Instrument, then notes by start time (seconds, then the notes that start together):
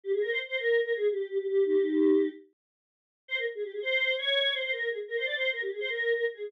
choir aahs
0.04 G4
0.13 G#4
0.22 A#4
0.31 C5
0.48 C5
0.57 A#4
0.84 A#4
0.93 G#4
1.11 G4
1.29 G4
1.38 G4
1.48 G4
1.66 D#4 G4
3.28 C5
3.37 A#4
3.55 G#4
3.64 G4
3.73 G#4
3.82 C5
4.18 C#5
4.54 C5
4.63 C5
4.72 A#4
4.90 G#4
5.08 A#4
5.17 C5
5.26 D5
5.35 C5
5.53 A#4
5.62 G4
5.71 G#4
5.80 C5
5.89 A#4
6.16 A#4
6.34 G#4